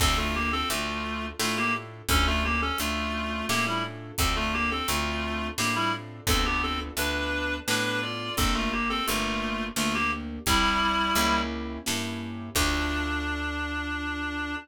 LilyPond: <<
  \new Staff \with { instrumentName = "Clarinet" } { \time 3/4 \key d \minor \tempo 4 = 86 <c' a'>16 <a f'>16 <bes g'>16 <c' a'>16 <a f'>4 <a f'>16 <bes g'>16 r8 | <cis' a'>16 <a f'>16 <bes g'>16 <cis' a'>16 <a f'>4 <bes g'>16 <g e'>16 r8 | <c' a'>16 <a f'>16 <bes g'>16 <c' a'>16 <a f'>4 <bes g'>16 <g e'>16 r8 | <c' a'>16 <b g'>16 <c' a'>16 r16 <d' b'>4 <d' b'>8 <f' d''>8 |
<c' a'>16 <a f'>16 <bes g'>16 <c' a'>16 <a f'>4 <a f'>16 <bes g'>16 r8 | <g e'>4. r4. | d'2. | }
  \new Staff \with { instrumentName = "Acoustic Grand Piano" } { \time 3/4 \key d \minor <d' f' a'>4 <d' f' a'>4 <d' f' a'>4 | <cis' d' f' a'>4 <cis' d' f' a'>4 <cis' d' f' a'>4 | <c' d' f' a'>4 <c' d' f' a'>4 <c' d' f' a'>4 | <b d' f' a'>4 <b d' f' a'>4 <b d' f' a'>4 |
<bes d' g'>4 <bes d' g'>4 <bes d' g'>4 | <c' e' g'>4 <bes cis' e' g'>4 <bes cis' e' g'>4 | <d' f' a'>2. | }
  \new Staff \with { instrumentName = "Electric Bass (finger)" } { \clef bass \time 3/4 \key d \minor d,4 d,4 a,4 | d,4 d,4 a,4 | d,4 d,4 a,4 | d,4 d,4 a,4 |
g,,4 g,,4 d,4 | c,4 cis,4 g,4 | d,2. | }
  \new DrumStaff \with { instrumentName = "Drums" } \drummode { \time 3/4 <cymc bd>4 hh4 sn4 | <hh bd>4 hh4 sn4 | <hh bd>4 hh4 sn4 | <hh bd>4 hh4 sn4 |
<hh bd>4 hh4 sn4 | <hh bd>4 hh4 sn4 | <cymc bd>4 r4 r4 | }
>>